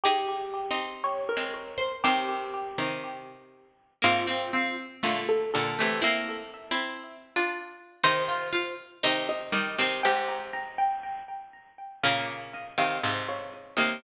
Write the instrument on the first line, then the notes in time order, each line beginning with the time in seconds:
pizzicato strings
0.04 D#4 G4 G#4
0.71 C4 D#4
1.04 C#5
1.29 A#4
1.37 G#3 C4
1.78 C5
2.04 C3 D#3 C4 G4
2.78 C3 D#3
4.02 G#2 C3 A#3 F4
4.27 C4
4.53 C4
5.03 A#2 D3 A3
5.29 A4
5.54 A#2 D3 A4
5.79 C3 E3 A3
6.02 A#3 C4 E4 E5
6.71 C4 E4
7.36 D4 F4
8.04 C3 D#3 D#4 C5
8.28 F4
8.53 F4
9.03 C3 D#3 D#4
9.29 D#5
9.52 D#3 G3 D#5
9.78 C3 D#3 C4
10.03 G#2 C3 G4 G5
10.28 A#5
10.53 A#5
10.78 G5
12.03 A#2 C#3 A#3 F5
12.54 D#5
12.78 C3 D#3 F5
13.04 G#2 C3
13.29 C#5
13.77 C3 D#3 A#3